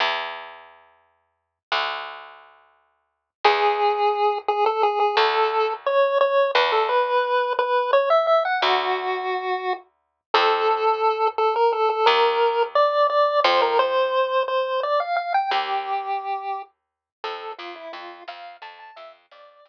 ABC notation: X:1
M:5/8
L:1/16
Q:1/4=87
K:Emix
V:1 name="Lead 1 (square)"
z10 | z10 | G6 G A G G | A4 c2 c2 B A |
B4 B2 c e e f | F8 z2 | [K:Fmix] A6 A B A A | B4 d2 d2 c B |
c4 c2 d f f g | G8 z2 | A2 F =E F2 f2 a a | =e z d4 z4 |]
V:2 name="Electric Bass (finger)" clef=bass
E,,10 | D,,10 | E,,10 | D,,8 E,,2- |
E,,10 | D,,10 | [K:Fmix] F,,10 | E,,8 F,,2- |
F,,10 | E,,10 | F,,2 F,,2 F,,2 F,,2 F,,2 | F,,2 F,,2 F,,2 z4 |]